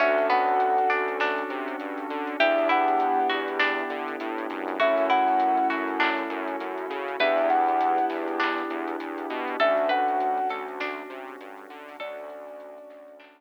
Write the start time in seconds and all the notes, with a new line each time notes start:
0.00 D2 C#4 D4 F#4 A4 E5, kick, closed hi-hat
0.18 closed hi-hat
0.30 B3 F#5, closed hi-hat
0.48 closed hi-hat
0.60 closed hi-hat
0.78 closed hi-hat
0.90 D2 D4, snare, closed hi-hat
1.08 closed hi-hat
1.20 D4, snare
1.38 closed hi-hat
1.50 C3, closed hi-hat
1.68 closed hi-hat
1.80 G2, closed hi-hat
1.98 closed hi-hat
2.10 D3, closed hi-hat
2.27 closed hi-hat
2.39 E2 B3 D4 E4 G4 E5, kick, closed hi-hat
2.58 closed hi-hat
2.69 E4 F#5, closed hi-hat
2.88 closed hi-hat
3.00 closed hi-hat
3.29 E2 F#4, snare, closed hi-hat
3.48 closed hi-hat
3.60 D4, snare
3.78 closed hi-hat
3.90 D3, closed hi-hat
4.08 closed hi-hat
4.20 A2, closed hi-hat
4.38 closed hi-hat
4.50 F#2, snare, closed hi-hat
4.68 snare, closed hi-hat
4.80 A3 C#4 E4 F#4 A4 E5, kick, closed hi-hat
4.98 closed hi-hat
5.10 E4 F#5, snare, closed hi-hat
5.28 snare, closed hi-hat
5.40 closed hi-hat
5.57 closed hi-hat
5.70 F#2 F#4, snare, closed hi-hat
5.88 closed hi-hat
6.00 D4, clap
6.18 closed hi-hat
6.30 F#2, kick, closed hi-hat
6.48 closed hi-hat
6.60 F#2, closed hi-hat
6.78 closed hi-hat
6.90 C#3, closed hi-hat
7.08 closed hi-hat
7.20 E2 B3 D4 E4 G4 B4 E5, kick, closed hi-hat
7.38 closed hi-hat
7.50 F#5, closed hi-hat
7.68 closed hi-hat
7.81 closed hi-hat
7.98 closed hi-hat
8.10 E2, snare, closed hi-hat
8.28 closed hi-hat
8.40 D4, clap
8.58 snare, closed hi-hat
8.70 E2, closed hi-hat
8.88 closed hi-hat
9.00 E2, closed hi-hat
9.18 closed hi-hat
9.30 B2, closed hi-hat
9.48 closed hi-hat
9.60 D2 A3 C#4 D4 F#4 A4 E5, kick, closed hi-hat
9.77 closed hi-hat
9.89 B4 F#5, closed hi-hat
10.08 closed hi-hat
10.20 closed hi-hat
10.38 closed hi-hat
10.49 D2 A4, snare, closed hi-hat
10.68 closed hi-hat
10.80 D4, snare
10.98 closed hi-hat
11.10 C3, closed hi-hat
11.28 closed hi-hat
11.40 G2, closed hi-hat
11.58 closed hi-hat
11.70 D3, closed hi-hat
11.88 open hi-hat
12.00 D2 A3 C#4 D4 F#4 A4 D5, kick, closed hi-hat
12.18 closed hi-hat
12.30 closed hi-hat
12.48 closed hi-hat
12.60 closed hi-hat
12.78 closed hi-hat
12.90 D2, snare, closed hi-hat
13.08 closed hi-hat
13.20 D4, clap
13.38 closed hi-hat